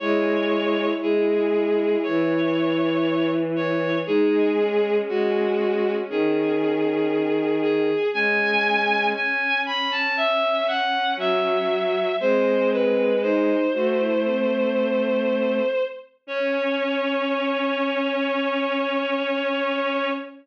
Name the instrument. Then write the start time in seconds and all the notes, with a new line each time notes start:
violin
0.00 G#3 E4 C#5
1.02 G#3 G#4
2.03 E3 C#5
3.56 C#5
4.06 G#3 D#4 G#4
4.58 C#4
5.08 G#3 F#4
6.09 D#3 G#4
7.62 G#4
8.13 G#3 C#4 G#5
9.15 G#5
9.66 B5
9.91 A5
10.17 E5
10.68 F#5
11.16 F#3 E5
12.20 G#3 C4 C5
12.71 B4
13.22 D#4 C5
13.73 A3 F#4
13.98 E4
14.24 C4
16.27 C#4 C#5